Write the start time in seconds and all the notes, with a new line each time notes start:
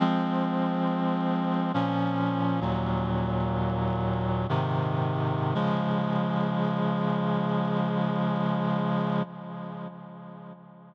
0.00 F3 G#3 C4
1.74 A#2 F3 C#4
2.61 D#2 A#2 F#3
4.49 G#2 C3 D#3
5.55 C#3 F3 G#3